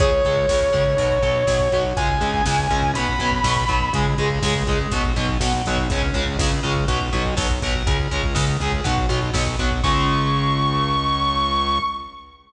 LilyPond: <<
  \new Staff \with { instrumentName = "Distortion Guitar" } { \time 4/4 \key cis \phrygian \tempo 4 = 122 cis''1 | gis''2 b''2 | r1 | r1 |
r1 | cis'''1 | }
  \new Staff \with { instrumentName = "Overdriven Guitar" } { \clef bass \time 4/4 \key cis \phrygian <cis gis>8 <cis gis>8 <cis gis>8 <cis gis>8 <b, fis>8 <b, fis>8 <b, fis>8 <b, fis>8 | <cis gis>8 <cis gis>8 <cis gis>8 <cis gis>8 <b, fis>8 <b, fis>8 <b, fis>8 <b, fis>8 | <cis gis>8 <cis gis>8 <cis gis>8 <cis gis>8 <b, fis>8 <b, fis>8 <b, fis>8 <b, fis>8 | <cis gis>8 <cis gis>8 <cis gis>8 <cis gis>8 <b, fis>8 <b, fis>8 <b, fis>8 <b, fis>8 |
<cis gis>8 <cis gis>8 <cis gis>8 <cis gis>8 <b, fis>8 <b, fis>8 <b, fis>8 <b, fis>8 | <cis gis>1 | }
  \new Staff \with { instrumentName = "Synth Bass 1" } { \clef bass \time 4/4 \key cis \phrygian cis,8 cis,8 cis,8 cis,8 b,,8 b,,8 b,,8 b,,8 | cis,8 cis,8 cis,8 cis,8 b,,8 b,,8 b,,8 b,,8 | cis,8 cis,8 cis,8 cis,8 b,,8 b,,8 b,,8 b,,8 | cis,8 cis,8 cis,8 cis,8 b,,8 b,,8 b,,8 b,,8 |
cis,8 cis,8 cis,8 cis,8 b,,8 b,,8 b,,8 b,,8 | cis,1 | }
  \new DrumStaff \with { instrumentName = "Drums" } \drummode { \time 4/4 <hh bd>16 bd16 <hh bd>16 bd16 <bd sn>16 bd16 <hh bd>16 bd16 <hh bd>16 bd16 <hh bd>16 bd16 <bd sn>16 bd16 <hh bd>16 bd16 | <hh bd>16 bd16 <hh bd>16 bd16 <bd sn>16 bd16 <hh bd>16 bd16 hh16 bd16 <hh bd>16 bd16 <bd sn>16 bd16 <hh bd>16 bd16 | <hh bd>16 bd16 <hh bd>16 bd16 <bd sn>16 bd16 <hh bd>16 bd16 <hh bd>16 bd16 <hh bd>16 bd16 <bd sn>16 bd16 <hho bd>16 bd16 | <hh bd>16 bd16 <hh bd>16 bd16 <bd sn>16 bd16 <hh bd>16 bd16 <hh bd>16 bd16 <hh bd>16 bd16 <bd sn>16 bd16 <hh bd>16 bd16 |
<hh bd>16 bd16 <hh bd>16 bd16 <bd sn>16 bd16 <hh bd>16 bd16 <hh bd>16 bd16 <hh bd>16 bd16 <bd sn>16 bd16 <hh bd>16 bd16 | <cymc bd>4 r4 r4 r4 | }
>>